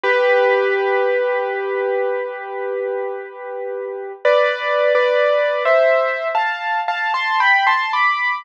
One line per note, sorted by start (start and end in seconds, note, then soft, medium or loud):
0.04 4.12 G4 loud
0.04 4.12 B4 loud
4.25 4.93 B4 loud
4.25 4.93 D5 loud
4.95 5.63 B4 medium
4.95 5.63 D5 loud
5.65 6.28 C5 medium
5.65 6.28 E5 loud
6.35 6.80 F5 medium
6.35 6.80 A5 medium
6.88 7.13 F5 medium
6.88 7.13 A5 loud
7.14 7.39 A5 medium
7.14 7.39 C6 loud
7.40 7.65 G5 medium
7.40 7.65 B5 loud
7.67 7.92 A5 medium
7.67 7.92 C6 loud
7.93 8.42 B5 medium
7.93 8.42 D6 medium